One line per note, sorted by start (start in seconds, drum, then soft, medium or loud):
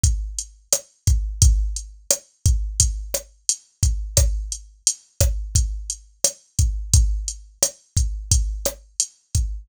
0.03 kick medium
0.03 closed hi-hat medium
0.39 closed hi-hat medium
0.72 cross-stick medium
0.72 closed hi-hat medium
1.07 kick medium
1.07 closed hi-hat medium
1.42 kick medium
1.42 closed hi-hat medium
1.76 closed hi-hat medium
2.10 cross-stick medium
2.10 closed hi-hat medium
2.46 kick medium
2.46 closed hi-hat medium
2.80 kick medium
2.80 closed hi-hat medium
3.14 cross-stick medium
3.14 closed hi-hat medium
3.49 closed hi-hat medium
3.83 kick medium
3.83 closed hi-hat medium
4.17 kick medium
4.17 cross-stick medium
4.17 closed hi-hat medium
4.52 closed hi-hat medium
4.87 closed hi-hat loud
5.20 kick medium
5.20 cross-stick medium
5.20 closed hi-hat medium
5.55 kick medium
5.55 closed hi-hat medium
5.90 closed hi-hat medium
6.24 cross-stick medium
6.24 closed hi-hat loud
6.59 kick medium
6.59 closed hi-hat medium
6.94 kick medium
6.94 closed hi-hat medium
7.28 closed hi-hat medium
7.62 cross-stick medium
7.62 closed hi-hat loud
7.97 kick medium
7.97 closed hi-hat medium
8.31 kick medium
8.31 closed hi-hat medium
8.65 cross-stick medium
8.65 closed hi-hat medium
9.00 closed hi-hat medium
9.35 kick medium
9.35 closed hi-hat medium